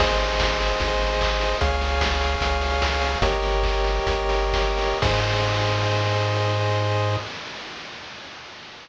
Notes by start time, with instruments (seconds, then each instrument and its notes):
0.00 synth bass 1 G#1, lead 1 (square) G#4 C5 D#5, kick, crash
0.20 open hi-hat
0.40 kick, snare
0.60 open hi-hat
0.80 synth bass 1 G#1, kick, closed hi-hat
1.01 open hi-hat
1.21 kick, clap
1.41 open hi-hat
1.61 synth bass 1 C#2, lead 1 (square) G#4 C#5 F5, kick, closed hi-hat
1.81 open hi-hat
2.01 kick, snare
2.21 open hi-hat
2.41 synth bass 1 C#2, kick, closed hi-hat
2.61 open hi-hat
2.82 kick, snare
3.02 open hi-hat
3.22 synth bass 1 G1, lead 1 (square) G4 A#4 C#5 D#5, kick, closed hi-hat
3.42 open hi-hat
3.63 kick, clap
3.84 open hi-hat
4.07 synth bass 1 G1, kick, closed hi-hat
4.29 open hi-hat
4.53 kick, snare
4.78 open hi-hat
5.02 synth bass 1 G#2, lead 1 (square) G#4 C5 D#5, kick, crash